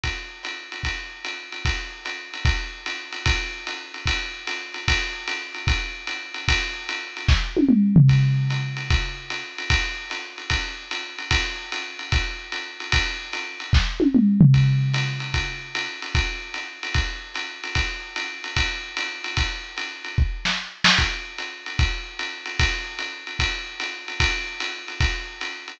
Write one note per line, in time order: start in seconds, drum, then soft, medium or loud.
0.04 kick soft
0.04 ride medium
0.43 hi-hat pedal medium
0.43 ride medium
0.72 ride medium
0.83 kick soft
0.83 ride medium
1.25 hi-hat pedal medium
1.25 ride medium
1.52 ride medium
1.65 kick medium
1.65 ride medium
2.05 hi-hat pedal medium
2.05 ride medium
2.34 ride medium
2.45 kick medium
2.45 ride medium
2.86 hi-hat pedal medium
2.86 ride medium
3.12 ride medium
3.26 kick medium
3.26 ride loud
3.67 hi-hat pedal medium
3.67 ride medium
3.94 ride medium
4.06 kick medium
4.06 ride loud
4.47 hi-hat pedal medium
4.47 ride medium
4.74 ride medium
4.88 kick medium
4.88 ride loud
5.28 hi-hat pedal medium
5.28 ride medium
5.54 ride medium
5.67 kick medium
5.67 ride loud
6.07 hi-hat pedal medium
6.07 ride medium
6.34 ride medium
6.48 kick medium
6.48 ride loud
6.89 hi-hat pedal medium
6.89 ride medium
7.17 ride medium
7.28 kick medium
7.28 snare medium
7.57 high tom medium
7.69 mid tom medium
7.96 floor tom loud
8.08 kick medium
8.08 ride medium
8.50 hi-hat pedal medium
8.50 ride medium
8.77 ride medium
8.90 kick medium
8.90 ride medium
9.30 hi-hat pedal medium
9.30 ride medium
9.58 ride medium
9.70 kick medium
9.70 ride loud
10.10 hi-hat pedal medium
10.10 ride medium
10.38 ride medium
10.50 kick medium
10.50 ride loud
10.91 hi-hat pedal medium
10.91 ride medium
11.18 ride medium
11.31 kick medium
11.31 ride loud
11.72 hi-hat pedal medium
11.72 ride medium
11.99 ride medium
12.12 kick medium
12.12 ride loud
12.52 hi-hat pedal medium
12.52 ride medium
12.80 ride medium
12.92 kick medium
12.92 ride loud
13.33 hi-hat pedal medium
13.33 ride medium
13.60 ride medium
13.73 kick medium
13.73 snare medium
14.00 high tom medium
14.15 mid tom medium
14.41 floor tom loud
14.54 kick medium
14.54 ride medium
14.93 hi-hat pedal medium
14.93 ride medium
15.20 ride medium
15.34 kick medium
15.34 ride medium
15.75 hi-hat pedal medium
15.75 ride medium
16.02 ride medium
16.15 kick medium
16.15 ride loud
16.54 hi-hat pedal medium
16.54 ride medium
16.83 ride medium
16.94 kick medium
16.94 ride medium
17.34 hi-hat pedal medium
17.34 ride medium
17.64 ride medium
17.75 kick medium
17.75 ride loud
18.16 hi-hat pedal medium
18.16 ride medium
18.44 ride medium
18.56 kick medium
18.56 ride loud
18.97 hi-hat pedal medium
18.97 ride medium
19.24 ride medium
19.37 kick medium
19.37 ride loud
19.77 hi-hat pedal medium
19.77 ride medium
20.04 ride medium
20.18 kick medium
20.45 snare medium
20.84 snare loud
20.98 kick medium
20.98 ride medium
21.38 hi-hat pedal medium
21.38 ride medium
21.66 ride medium
21.79 kick medium
21.79 ride medium
22.19 hi-hat pedal medium
22.19 ride medium
22.46 ride medium
22.59 kick medium
22.59 ride loud
22.99 hi-hat pedal medium
22.99 ride medium
23.27 ride medium
23.39 kick medium
23.39 ride loud
23.80 hi-hat pedal medium
23.80 ride medium
24.08 ride medium
24.20 kick medium
24.20 ride loud
24.60 hi-hat pedal medium
24.60 ride medium
24.88 ride medium
25.00 kick medium
25.00 ride loud
25.41 hi-hat pedal medium
25.41 ride medium
25.68 ride medium